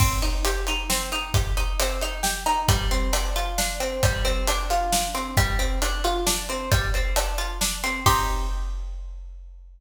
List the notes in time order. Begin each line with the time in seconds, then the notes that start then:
0.00 C4, kick, crash
0.22 D#4, closed hi-hat
0.45 G4, closed hi-hat
0.67 D#4, closed hi-hat
0.90 C4, snare
1.12 D#4, closed hi-hat
1.34 G4, kick, closed hi-hat
1.57 D#4, closed hi-hat
1.80 C4, closed hi-hat
2.01 D#4, closed hi-hat
2.23 G4, snare
2.46 D#4, closed hi-hat
2.68 G3, kick, closed hi-hat
2.91 C4, closed hi-hat
3.13 D4, closed hi-hat
3.36 F4, closed hi-hat
3.58 D4, snare
3.80 C4, closed hi-hat
4.03 G3, kick, closed hi-hat
4.25 C4, closed hi-hat
4.47 D4, closed hi-hat
4.70 F4, closed hi-hat
4.92 D4, snare
5.15 C4, closed hi-hat
5.37 G3, kick, closed hi-hat
5.59 C4, closed hi-hat
5.82 D4, closed hi-hat
6.04 F4, closed hi-hat
6.26 D4, snare
6.49 C4, closed hi-hat
6.71 G3, kick, closed hi-hat
6.94 C4, closed hi-hat
7.16 D4, closed hi-hat
7.38 F4, closed hi-hat
7.61 D4, snare
7.84 C4, closed hi-hat
8.06 C4 D#4 G4, kick, crash